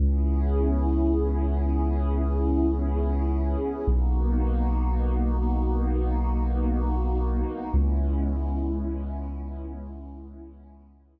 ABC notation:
X:1
M:4/4
L:1/8
Q:1/4=124
K:C#m
V:1 name="Pad 5 (bowed)"
[B,CEG]8- | [B,CEG]8 | [^A,B,DF]8- | [^A,B,DF]8 |
[G,B,CE]8- | [G,B,CE]8 |]
V:2 name="Synth Bass 2" clef=bass
C,,8- | C,,8 | B,,,8- | B,,,8 |
C,,8- | C,,8 |]